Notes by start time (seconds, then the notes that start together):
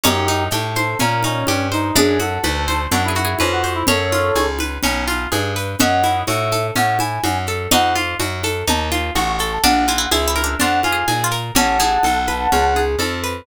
0.04 F#2 C#4 D#4 G4, cowbell, low conga, shaker
0.28 D#4, high conga, shaker
0.51 A2 G4 A4, cowbell, high conga, shaker
0.75 C5, high conga, shaker
0.99 A#2 C#4 A#4, cowbell, low conga, shaker
1.23 C#4 D#4, high conga, shaker
1.47 G2 G4, cowbell, high conga, shaker
1.72 D#4 C5, shaker
1.96 F#2 D4 G#4, cowbell, low conga, shaker
2.19 F#4 A4, high conga, shaker
2.43 D2 B4, cowbell, high conga, shaker
2.68 C5, high conga, shaker
2.92 F#2 D4 E4 F#4, cowbell, low conga, shaker
3.04 E4
3.08 G#4
3.15 F#4, high conga, shaker
3.25 G#4
3.39 F2 C#4 B4, cowbell, high conga, shaker
3.52 F#4
3.64 C5, shaker
3.75 E4
3.87 F#2 C#4 A4 C#5, cowbell, low conga, shaker
4.12 F4, high conga, shaker
4.35 C#2 G#4, cowbell, high conga, shaker
4.59 B4, high conga, shaker
4.83 B1 C#4, cowbell, low conga, shaker
5.08 F4, high conga, shaker
5.32 G2 G#4, cowbell, high conga, shaker
5.56 B4, shaker
5.79 F#2 C#4 D#5 E5 F#5, cowbell, low conga, shaker
6.04 E4, high conga, shaker
6.27 A2 F#4 E5, cowbell, high conga, shaker
6.52 A4, high conga, shaker
6.75 A2 C#4 F#5, cowbell, low conga, shaker
6.99 E4 G#5, high conga, shaker
7.24 F#2 F#4, cowbell, high conga, shaker
7.47 A4, shaker
7.71 F2 D#4 F#5, cowbell, low conga, shaker
7.96 F4, high conga, shaker
8.20 F#2 F#4, cowbell, high conga, shaker
8.44 A4, high conga, shaker
8.67 D#2 D#4 A5, cowbell, low conga, shaker
8.91 F4, high conga, shaker
9.15 A1 F#4 C#6, cowbell, high conga, shaker
9.28 C#6
9.39 A4, shaker
9.52 A5
9.63 A#1 D4 F#5, cowbell, low conga, shaker
9.88 E4 F4, high conga, shaker
9.98 E4
10.11 C#2 E4 G#4 E5, cowbell, high conga, shaker
10.28 E4
10.36 A#4, high conga, shaker
10.44 D4
10.59 F2 D4 F4 F#5, cowbell, low conga, shaker
10.83 F4 G#5, high conga, shaker
10.93 G#4
11.08 A#2 G#4, cowbell, high conga, shaker
11.24 F4
11.31 A#4, shaker
11.55 A1 E3 C#4 F#5 A5, cowbell, low conga, shaker
11.79 E3 G#4, high conga, shaker
12.03 B1 A4, cowbell, high conga, shaker
12.27 B4, high conga, shaker
12.52 C#2 C#4, cowbell, low conga, shaker
12.76 G#4, high conga, shaker
12.99 F2 A4, cowbell, high conga, shaker
13.23 B4, shaker